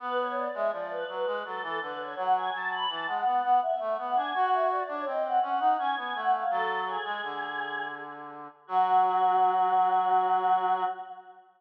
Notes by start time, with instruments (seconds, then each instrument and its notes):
0.00 brass section B3, choir aahs B4
0.17 choir aahs C#5
0.36 choir aahs D5
0.54 brass section G#3, choir aahs E5
0.72 brass section F3, choir aahs D5
0.91 choir aahs B4
1.08 brass section F#3, choir aahs B4
1.26 brass section G#3
1.45 brass section F#3, choir aahs A4
1.62 brass section E3, choir aahs A4
1.81 brass section D3, choir aahs B4
1.99 choir aahs C#5
2.16 brass section F#3, choir aahs F#5
2.35 choir aahs G#5
2.53 brass section F#3, choir aahs A5
2.71 choir aahs B5
2.89 brass section E3, choir aahs A5
3.07 brass section G#3, choir aahs F#5
3.25 brass section B3, choir aahs F#5
3.43 brass section B3
3.62 choir aahs E5
3.80 brass section A3, choir aahs E5
3.98 brass section B3, choir aahs F#5
4.16 brass section D4, choir aahs G#5
4.34 brass section F#4, choir aahs F#5
4.52 choir aahs E5
4.71 choir aahs D5
4.88 brass section D4, choir aahs C#5
5.06 brass section C4, choir aahs D#5
5.24 choir aahs F#5
5.42 brass section C#4, choir aahs F#5
5.60 brass section D#4
5.78 brass section C#4, choir aahs G#5
5.97 brass section B3, choir aahs G#5
6.14 brass section A3, choir aahs F#5
6.32 choir aahs F5
6.50 brass section F#3, choir aahs A4
6.86 choir aahs G#4
7.05 brass section G#3
7.23 brass section D3
8.67 brass section F#3, choir aahs F#4